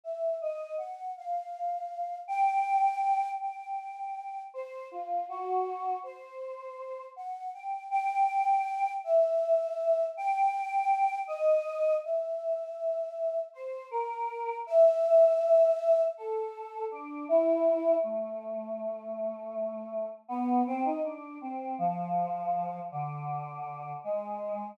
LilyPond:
\new Staff { \time 9/8 \partial 4. \tempo 4. = 53 e''8 ees''8 ges''8 | f''4. g''4. g''4. | c''8 f'8 ges'4 c''4. ges''8 g''8 | g''4. e''4. g''4. |
ees''4 e''2 c''8 bes'4 | e''2 a'4 d'8 e'4 | a2. b8 c'16 ees'16 d'8 | c'8 f4. d4. aes4 | }